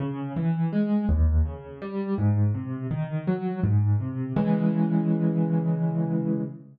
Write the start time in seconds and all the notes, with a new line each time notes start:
0.00 C#3
0.37 E3
0.73 G#3
1.09 D#2
1.45 C#3
1.82 G3
2.18 G#2
2.54 C3
2.91 D#3
3.27 F#3
3.63 G#2
4.00 C3
4.36 C#3 E3 G#3